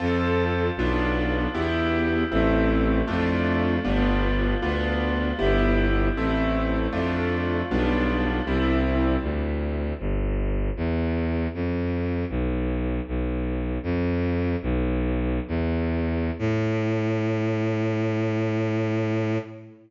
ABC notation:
X:1
M:3/4
L:1/8
Q:1/4=78
K:C
V:1 name="Acoustic Grand Piano"
[CFA]2 [B,DF]2 [B,EG]2 | [A,CE]2 [A,DF]2 [G,B,DF]2 | [B,DF]2 [B,EG]2 [A,CE]2 | [A,DF]2 [G,B,DF]2 [G,CE]2 |
[K:Am] z6 | z6 | "^rit." z6 | z6 |]
V:2 name="Violin" clef=bass
F,,2 B,,,2 E,,2 | A,,,2 F,,2 G,,,2 | D,,2 G,,,2 A,,,2 | F,,2 B,,,2 C,,2 |
[K:Am] D,,2 G,,,2 E,,2 | F,,2 B,,,2 B,,,2 | "^rit." F,,2 B,,,2 E,,2 | A,,6 |]